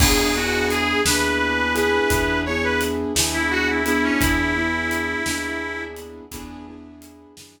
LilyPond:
<<
  \new Staff \with { instrumentName = "Harmonica" } { \time 12/8 \key e \major \tempo 4. = 57 gis'8 fis'8 gis'8 b'4 b'4 cis''16 b'16 r8. e'16 fis'16 e'16 e'16 cis'16 | e'2~ e'8 r2. r8 | }
  \new Staff \with { instrumentName = "Acoustic Grand Piano" } { \time 12/8 \key e \major <b d' e' gis'>8 <b d' e' gis'>4 <b d' e' gis'>4 <b d' e' gis'>4 <b d' e' gis'>4 <b d' e' gis'>4 <b d' e' gis'>8~ | <b d' e' gis'>8 <b d' e' gis'>4 <b d' e' gis'>4. <b d' e' gis'>8 <b d' e' gis'>4 <b d' e' gis'>4 r8 | }
  \new Staff \with { instrumentName = "Electric Bass (finger)" } { \clef bass \time 12/8 \key e \major e,4. dis,4. e,4. dis,4. | e,4. dis,4. e,4. fis,4. | }
  \new DrumStaff \with { instrumentName = "Drums" } \drummode { \time 12/8 <cymc bd>4 hh8 sn4 hh8 <hh bd>4 hh8 sn4 hh8 | <hh bd>4 hh8 sn4 hh8 <hh bd>4 hh8 sn4. | }
>>